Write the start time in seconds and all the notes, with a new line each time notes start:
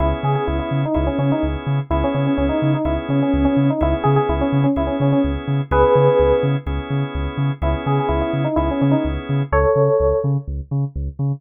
0.00 C#2 B3 C#4 E4 G#4
0.23 C#3 G#4
0.35 G#4
0.47 C#2 E4
0.59 E4
0.71 C#3
0.85 D#4
0.94 C#2 B3 C#4 E4 G#4
1.07 C#4
1.18 C#3 C#4
1.32 D#4
1.43 C#2
1.67 C#3
1.90 C#2 B3 C#4 E4 G#4
2.04 C#4
2.14 C#3 C#4
2.27 C#4
2.37 C#2 C#4
2.49 D#4
2.62 C#3
2.74 D#4
2.85 C#2 B3 C#4 E4 G#4
3.09 C#3 C#4
3.22 C#4
3.34 C#2
3.45 C#4
3.57 C#3
3.70 D#4
3.81 C#2 B3 C#4 E4 G#4
4.04 C#3 G#4
4.16 G#4
4.29 C#2 E4
4.41 C#4
4.52 C#3
4.64 C#4
4.76 C#2 B3 C#4 E4 G#4
4.87 C#4
5.00 C#3 C#4
5.12 C#4
5.24 C#2
5.48 C#3
5.71 C#2 B3 C#4 E4 G#4 B4
5.95 C#3
6.20 C#2
6.43 C#3
6.66 C#2 B3 C#4 E4 G#4
6.90 C#3
7.15 C#2
7.37 C#3
7.62 C#2 B3 C#4 E4 G#4
7.86 C#3 G#4
8.00 G#4
8.09 C#2 E4
8.21 E4
8.33 C#3
8.45 D#4
8.56 C#2 B3 C#4 E4 G#4
8.71 C#4
8.81 C#3 C#4
8.91 D#4
9.05 C#2
9.29 C#3
9.52 C#2 A4 C#5
9.76 C#3
10.00 C#2
10.24 C#3
10.48 C#2
10.71 C#3
10.96 C#2
11.19 C#3